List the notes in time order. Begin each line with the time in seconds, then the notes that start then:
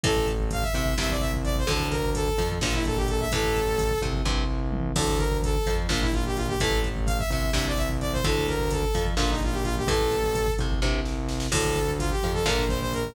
0.04 A1 A2 E3 A4, kick, closed hi-hat
0.16 kick
0.27 kick, closed hi-hat
0.40 kick
0.51 F5, kick, closed hi-hat
0.62 E5, kick
0.74 C2 C3 E5, kick, closed hi-hat
0.86 kick
0.98 C2 G2 C3 E5, kick, snare
1.10 D5, kick
1.20 E5, kick, closed hi-hat
1.33 kick
1.45 D5, kick, closed hi-hat
1.56 C5, kick
1.67 D2 A2 D3 A4, kick, closed hi-hat
1.80 kick
1.90 A#4, kick, closed hi-hat
2.03 kick
2.15 A4, kick, closed hi-hat
2.27 kick
2.38 F2 F3, kick, closed hi-hat
2.50 kick
2.61 A#1 A#2 D3 F3 F4, kick, snare
2.73 E4, kick
2.85 A4, kick, closed hi-hat
2.97 G4, kick
3.08 A4, kick, closed hi-hat
3.20 E5, kick
3.32 A1 A2 E3 A4, kick, closed hi-hat
3.43 kick
3.55 kick, closed hi-hat
3.68 kick
3.79 kick, closed hi-hat
3.91 kick
4.02 C2 C3, kick, closed hi-hat
4.14 kick
4.25 C2 G2 C3, kick
4.72 mid tom
4.96 D2 A2 D3 A4, kick, crash
5.08 kick
5.18 A#4, kick, closed hi-hat
5.31 kick
5.43 A4, kick, closed hi-hat
5.55 kick
5.66 F2 F3, kick, closed hi-hat
5.78 kick
5.88 A#1 A#2 D3 F3 F4, kick, snare
6.01 E4, kick
6.13 F4, kick, closed hi-hat
6.25 G4, kick
6.36 F4, kick, closed hi-hat
6.48 G4, kick
6.60 A1 A2 E3 A4, kick, closed hi-hat
6.71 kick
6.84 kick, closed hi-hat
6.96 kick
7.06 F5, kick, closed hi-hat
7.19 E5, kick
7.30 C2 C3 E5, kick, closed hi-hat
7.43 kick
7.53 C2 G2 C3 E5, kick, snare
7.65 D5, kick
7.77 E5, kick, closed hi-hat
7.90 kick
8.00 D5, kick, closed hi-hat
8.13 C5, kick
8.24 D2 A2 D3 A4, kick, closed hi-hat
8.36 kick
8.48 A#4, kick, closed hi-hat
8.59 kick
8.71 A4, kick, closed hi-hat
8.83 kick
8.94 F2 F3, kick, closed hi-hat
9.07 kick
9.17 A#1 A#2 D3 F3 F4, kick, snare
9.30 D#4, kick
9.42 F4, kick, closed hi-hat
9.52 G4, kick
9.63 F4, kick, closed hi-hat
9.77 G4, kick
9.87 A1 A2 E3 A4, kick, closed hi-hat
10.01 kick
10.11 kick, closed hi-hat
10.24 kick
10.35 kick, closed hi-hat
10.47 kick
10.58 C2 C3, kick, closed hi-hat
10.71 kick
10.82 C2 G2 C3, kick, snare
11.05 snare
11.29 snare
11.40 snare
11.52 D2 A2 D3 A4, kick, crash
11.65 kick
11.76 kick, closed hi-hat
11.88 kick
11.99 F4, kick, closed hi-hat
12.11 G4, kick
12.23 F2 F3, kick, closed hi-hat
12.34 A4, kick
12.46 A#1 A#2 D3 F3 A#4, kick, snare
12.58 kick
12.68 C5, kick, closed hi-hat
12.81 C5, kick
12.93 A#4, kick, closed hi-hat
13.05 kick